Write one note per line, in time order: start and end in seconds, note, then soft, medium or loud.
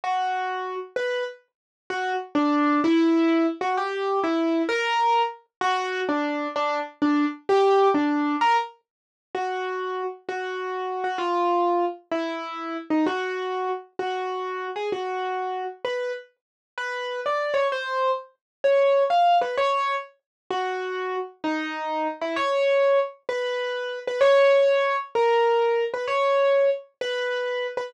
0.04 0.76 F#4 medium
0.96 1.24 B4 medium
1.90 2.13 F#4 medium
2.35 2.80 D4 medium
2.84 3.46 E4 loud
3.61 3.74 F#4 medium
3.77 4.19 G4 medium
4.24 4.62 E4 medium
4.69 5.22 A#4 loud
5.61 6.00 F#4 loud
6.09 6.47 D4 medium
6.56 6.79 D4 medium
7.02 7.25 D4 medium
7.49 7.88 G4 loud
7.94 8.36 D4 medium
8.41 8.57 A#4 loud
9.35 10.03 F#4 medium
10.29 11.03 F#4 medium
11.04 11.18 F#4 medium
11.18 11.85 F4 medium
12.11 12.77 E4 medium
12.90 13.05 D#4 medium
13.06 13.69 F#4 medium
13.99 14.68 F#4 medium
14.76 14.89 G#4 medium
14.92 15.64 F#4 medium
15.85 16.12 B4 medium
16.78 17.20 B4 medium
17.26 17.56 D5 medium
17.54 17.67 C#5 medium
17.72 18.11 C5 medium
18.64 19.03 C#5 medium
19.10 19.37 F5 medium
19.41 19.56 B4 medium
19.57 19.95 C#5 medium
20.50 21.16 F#4 medium
21.44 22.07 D#4 medium
22.21 22.36 E4 medium
22.36 22.99 C#5 medium
23.29 23.99 B4 medium
24.07 24.20 B4 medium
24.21 24.96 C#5 loud
25.15 25.84 A#4 medium
25.94 26.06 B4 medium
26.07 26.70 C#5 medium
27.01 27.67 B4 medium
27.77 27.90 B4 medium